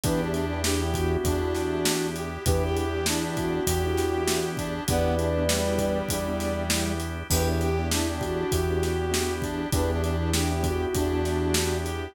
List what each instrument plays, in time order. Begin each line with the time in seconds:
0.03 synth bass 1 E2, acoustic grand piano B3 D4 E4 G4, drawbar organ B3 D4 E4 G4, brass section D4, ocarina B4, kick, closed hi-hat
0.21 brass section D4, ocarina G4
0.34 brass section D4, closed hi-hat
0.53 acoustic grand piano B3 D4 E4 G4
0.64 ocarina D4, brass section G4, snare
0.82 acoustic grand piano B3 D4 E4 G4
0.94 acoustic grand piano B3 D4 E4 G4, ocarina F#4, kick, closed hi-hat
1.24 synth bass 1 E2, acoustic grand piano B3 D4 E4 G4, brass section D4, kick, closed hi-hat
1.43 acoustic grand piano B3 D4 E4 G4
1.55 snare, closed hi-hat
1.85 acoustic grand piano B3 D4 E4 G4, snare
2.16 brass section G4, closed hi-hat
2.46 synth bass 1 E2, drawbar organ B3 D4 E4 G4, acoustic grand piano B3 D4 E4 G4, brass section G4, ocarina B4, kick, closed hi-hat
2.64 brass section G4, ocarina G4
2.77 brass section G4, closed hi-hat
2.94 acoustic grand piano B3 D4 E4 G4
3.06 brass section D4, ocarina E4, snare
3.25 acoustic grand piano B3 D4 E4 G4
3.37 acoustic grand piano B3 D4 E4 G4, ocarina F#4, kick, closed hi-hat
3.67 synth bass 1 E2, acoustic grand piano B3 D4 E4 G4, brass section G4, kick, closed hi-hat
3.86 acoustic grand piano B3 D4 E4 G4
3.97 snare, closed hi-hat
4.27 acoustic grand piano B3 D4 E4 G4, snare
4.57 brass section D4, kick, closed hi-hat
4.87 synth bass 1 E2, drawbar organ B3 D4 E4 G4, acoustic grand piano B3 D4 E4 G4, brass section B3, ocarina B4 D5, kick, closed hi-hat
5.18 brass section D4, closed hi-hat
5.38 acoustic grand piano B3 D4 E4 G4
5.48 brass section G3, snare
5.69 acoustic grand piano B3 D4 E4 G4
5.78 acoustic grand piano B3 D4 E4 G4, kick, closed hi-hat
6.08 synth bass 1 E2, acoustic grand piano B3 D4 E4 G4, ocarina D5, kick, closed hi-hat
6.28 acoustic grand piano B3 D4 E4 G4
6.40 snare, closed hi-hat
6.70 acoustic grand piano B3 D4 E4 G4, snare
7.00 closed hi-hat
7.30 synth bass 1 E2, acoustic grand piano B3 D4 E4 G4, drawbar organ B3 D4 E4 G4, brass section G4, ocarina B4, kick, crash
7.49 ocarina G4, brass section G4
7.61 brass section G4, closed hi-hat
7.79 acoustic grand piano B3 D4 E4 G4
7.91 brass section D4, ocarina E4, snare
8.10 acoustic grand piano B3 D4 E4 G4
8.21 acoustic grand piano B3 D4 E4 G4, ocarina F#4, kick, closed hi-hat
8.52 synth bass 1 E2, acoustic grand piano B3 D4 E4 G4, brass section G4, kick, closed hi-hat
8.70 acoustic grand piano B3 D4 E4 G4
8.83 snare, closed hi-hat
9.11 acoustic grand piano B3 D4 E4 G4, snare
9.42 brass section D4, kick, closed hi-hat
9.72 synth bass 1 E2, acoustic grand piano B3 D4 E4 G4, drawbar organ B3 D4 E4 G4, brass section D4, ocarina B4, kick, closed hi-hat
9.91 brass section D4, ocarina G4
10.03 brass section D4, closed hi-hat
10.22 acoustic grand piano B3 D4 E4 G4
10.33 ocarina D4, brass section G4, snare
10.51 acoustic grand piano B3 D4 E4 G4
10.63 acoustic grand piano B3 D4 E4 G4, ocarina F#4, kick, closed hi-hat
10.93 synth bass 1 E2, acoustic grand piano B3 D4 E4 G4, brass section D4, kick, closed hi-hat
11.14 acoustic grand piano B3 D4 E4 G4
11.25 snare, closed hi-hat
11.54 acoustic grand piano B3 D4 E4 G4, snare
11.86 brass section G4, closed hi-hat